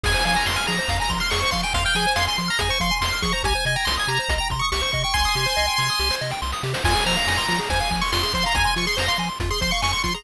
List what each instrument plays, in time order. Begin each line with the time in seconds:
0.04 synth bass 1 F2, lead 1 (square) G#4 G#5, kick, crash
0.14 lead 1 (square) C5
0.25 synth bass 1 F3, lead 1 (square) F5 G#5, closed hi-hat
0.36 lead 1 (square) G#5 A#5
0.46 synth bass 1 F2, lead 1 (square) C6, snare
0.56 lead 1 (square) G#5 F6
0.67 synth bass 1 F3, lead 1 (square) G#4 A#5, closed hi-hat
0.79 lead 1 (square) C5
0.88 synth bass 1 F2, lead 1 (square) F5, kick, closed hi-hat
1.00 lead 1 (square) G#5 A#5
1.10 synth bass 1 F3, lead 1 (square) C6, kick, closed hi-hat
1.20 lead 1 (square) C6 F6
1.30 synth bass 1 F2, lead 1 (square) G#4 C#6, snare
1.40 lead 1 (square) C5 C#6
1.51 synth bass 1 F3, lead 1 (square) F5 C6, kick, closed hi-hat
1.63 lead 1 (square) G5 G#5
1.74 synth bass 1 F2, lead 1 (square) F5 C6, kick, closed hi-hat
1.85 lead 1 (square) G5 F6
1.95 synth bass 1 F3, lead 1 (square) G#4 G#5, closed hi-hat
2.07 lead 1 (square) C5
2.16 synth bass 1 F2, lead 1 (square) F5 C6, snare
2.27 lead 1 (square) G#5 C6
2.38 synth bass 1 F3, lead 1 (square) C6, closed hi-hat
2.48 lead 1 (square) A#5 F6
2.59 synth bass 1 F2, lead 1 (square) G#4 G#5, kick, closed hi-hat
2.69 lead 1 (square) C5 C#6
2.80 synth bass 1 F3, lead 1 (square) F5 C6, kick, closed hi-hat
2.91 lead 1 (square) G#5
3.01 synth bass 1 F2, lead 1 (square) C6, snare
3.13 lead 1 (square) F6
3.22 synth bass 1 F3, lead 1 (square) G#4 C#6, kick, closed hi-hat
3.33 lead 1 (square) C5 A#5
3.43 synth bass 1 C2, lead 1 (square) G4 G#5, kick, closed hi-hat
3.55 lead 1 (square) C5
3.65 synth bass 1 C3, lead 1 (square) D#5 G#5, closed hi-hat
3.76 lead 1 (square) G5 A#5
3.85 synth bass 1 C2, lead 1 (square) C6, snare
3.97 lead 1 (square) G#5 D#6
4.08 synth bass 1 C3, lead 1 (square) G4 A#5, closed hi-hat
4.19 lead 1 (square) C5
4.29 synth bass 1 C2, lead 1 (square) D#5, kick, closed hi-hat
4.38 lead 1 (square) G5 A#5
4.50 synth bass 1 C3, lead 1 (square) C6, kick, closed hi-hat
4.59 lead 1 (square) C#6 D#6
4.72 synth bass 1 C2, lead 1 (square) G4 C#6, snare
4.82 lead 1 (square) C5 C#6
4.92 synth bass 1 C3, lead 1 (square) D#5 C#6, kick, closed hi-hat
5.04 lead 1 (square) G5 C#6
5.14 synth bass 1 C2, lead 1 (square) G#5 C6, kick, snare
5.25 lead 1 (square) D#6
5.35 synth bass 1 C3, lead 1 (square) G4, snare
5.46 lead 1 (square) C5
5.57 synth bass 1 C2, lead 1 (square) D#5, snare
5.67 lead 1 (square) G5
5.78 synth bass 1 C3, lead 1 (square) C6, snare
5.90 lead 1 (square) D#6
5.99 synth bass 1 C2, lead 1 (square) G4, snare
6.10 lead 1 (square) C5, snare
6.21 synth bass 1 C3, lead 1 (square) D#5, snare
6.31 lead 1 (square) G5, snare
6.42 synth bass 1 C2, lead 1 (square) C6, snare
6.52 lead 1 (square) D#6, snare
6.63 synth bass 1 C3, lead 1 (square) G4, snare
6.74 lead 1 (square) C5, snare
6.84 synth bass 1 F2, lead 1 (square) F4 G#5, kick, crash
6.95 lead 1 (square) G#4
7.06 synth bass 1 F3, lead 1 (square) C5 A#5, closed hi-hat
7.17 lead 1 (square) F5
7.27 synth bass 1 F2, lead 1 (square) G#5, snare
7.37 lead 1 (square) C6
7.48 synth bass 1 F3, lead 1 (square) F4, closed hi-hat
7.59 lead 1 (square) G#4
7.70 synth bass 1 F2, lead 1 (square) C5 G#5, kick, closed hi-hat
7.80 lead 1 (square) F5
7.91 synth bass 1 F3, lead 1 (square) G#5, kick, closed hi-hat
8.01 lead 1 (square) C6 C#6
8.12 synth bass 1 F2, lead 1 (square) F4 C6, snare
8.23 lead 1 (square) G#4 C6
8.33 synth bass 1 F3, lead 1 (square) C5 C6, kick, closed hi-hat
8.44 lead 1 (square) F5 A#5
8.55 synth bass 1 F2, lead 1 (square) G#5, kick, closed hi-hat
8.65 lead 1 (square) C6
8.76 synth bass 1 F3, lead 1 (square) F4 C#6, closed hi-hat
8.87 lead 1 (square) G#4 C6
8.97 synth bass 1 F2, lead 1 (square) C5 A#5, snare
9.08 lead 1 (square) F5 C6
9.18 synth bass 1 F3, lead 1 (square) G#5, closed hi-hat
9.29 lead 1 (square) C6
9.40 synth bass 1 F2, lead 1 (square) F4, kick, closed hi-hat
9.51 lead 1 (square) G#4 C6
9.61 synth bass 1 F3, lead 1 (square) C5 C6, kick, closed hi-hat
9.71 lead 1 (square) F5 C#6
9.82 synth bass 1 F2, lead 1 (square) G#5 C#6, snare
9.92 lead 1 (square) C6 C#6
10.04 synth bass 1 F3, lead 1 (square) F4 C6, kick, closed hi-hat
10.14 lead 1 (square) G#4 A#5